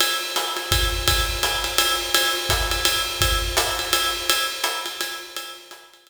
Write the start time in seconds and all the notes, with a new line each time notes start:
0.00 ride
0.36 hi-hat pedal, ride
0.57 ride
0.72 kick, ride
1.08 kick, ride
1.43 hi-hat pedal, ride
1.64 ride
1.78 ride
2.14 ride
2.49 kick, hi-hat pedal, ride
2.71 ride
2.85 ride
3.21 kick, ride
3.57 hi-hat pedal, ride
3.79 ride
3.93 ride
4.29 ride
4.64 hi-hat pedal, ride
4.86 ride
5.01 ride
5.36 ride
5.71 hi-hat pedal, ride
5.93 ride
6.07 ride